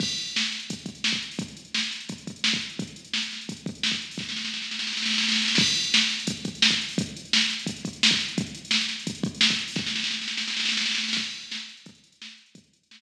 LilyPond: \new DrumStaff \drummode { \time 4/4 \tempo 4 = 172 <cymc bd>16 hh16 hh16 hh16 sn16 hh16 <hh sn>16 hh16 <hh bd>16 hh16 <hh bd>16 hh16 sn16 <hh bd>16 hh16 hho16 | <hh bd>16 hh16 hh16 hh16 sn16 hh16 <hh sn>16 hh16 <hh bd>16 hh16 <hh bd>16 hh16 sn16 <hh bd>16 hh16 hh16 | <hh bd>16 hh16 hh16 hh16 sn16 hh16 <hh sn>16 hh16 <hh bd>16 hh16 <hh bd>16 hh16 sn16 <hh bd>16 hh16 hho16 | <bd sn>16 sn16 sn16 sn16 sn16 sn16 sn16 sn16 sn32 sn32 sn32 sn32 sn32 sn32 sn32 sn32 sn32 sn32 sn32 sn32 sn32 sn32 sn32 sn32 |
<cymc bd>16 hh16 hh16 hh16 sn16 hh16 <hh sn>16 hh16 <hh bd>16 hh16 <hh bd>16 hh16 sn16 <hh bd>16 hh16 hho16 | <hh bd>16 hh16 hh16 hh16 sn16 hh16 <hh sn>16 hh16 <hh bd>16 hh16 <hh bd>16 hh16 sn16 <hh bd>16 hh16 hh16 | <hh bd>16 hh16 hh16 hh16 sn16 hh16 <hh sn>16 hh16 <hh bd>16 hh16 <hh bd>16 hh16 sn16 <hh bd>16 hh16 hho16 | <bd sn>16 sn16 sn16 sn16 sn16 sn16 sn16 sn16 sn32 sn32 sn32 sn32 sn32 sn32 sn32 sn32 sn32 sn32 sn32 sn32 sn32 sn32 sn32 sn32 |
<cymc bd>16 hh16 hh16 hh16 sn16 hh16 hh16 hh16 <hh bd>16 hh16 hh16 hh16 sn16 hh16 hh16 hh16 | <hh bd>16 hh16 hh16 hh16 sn16 hh8. r4 r4 | }